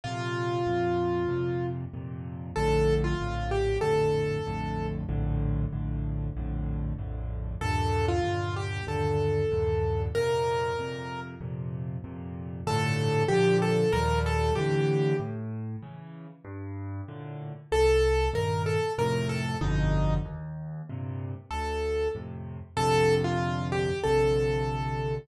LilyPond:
<<
  \new Staff \with { instrumentName = "Acoustic Grand Piano" } { \time 4/4 \key bes \major \tempo 4 = 95 f'2. r4 | a'8. f'8. g'8 a'2 | r1 | a'8. f'8. g'8 a'2 |
bes'2 r2 | \key g \minor a'4 g'8 a'8 bes'8 a'8 g'4 | r1 | a'4 bes'8 a'8 bes'8 a'8 ees'4 |
r2 a'4 r4 | \key bes \major a'8. f'8. g'8 a'2 | }
  \new Staff \with { instrumentName = "Acoustic Grand Piano" } { \clef bass \time 4/4 \key bes \major <f, bes, c>4 <f, bes, c>4 <f, bes, c>4 <f, bes, c>4 | <bes,, f, a, d>4 <bes,, f, a, d>4 <bes,, f, a, d>4 <bes,, f, a, d>4 | <bes,, f, a, d>4 <bes,, f, a, d>4 <bes,, f, a, d>4 <bes,, f, a, d>4 | <ees, g, bes, d>4 <ees, g, bes, d>4 <ees, g, bes, d>4 <ees, g, bes, d>4 |
<f, bes, c>4 <f, bes, c>4 <f, bes, c>4 <f, bes, c>4 | \key g \minor <g, a, bes, d>4 <bes, d f>4 <ees, bes, f g>4 <a, d e>4 | a,4 <cis e>4 g,4 <a, bes, d>4 | c,4 <g, bes, ees>4 <f, a, c>4 <g,, f, b, d>4 |
ees,4 <g, bes, c>4 d,4 <f, a, c>4 | \key bes \major <bes,, f, c d>2 <bes,, f, c d>2 | }
>>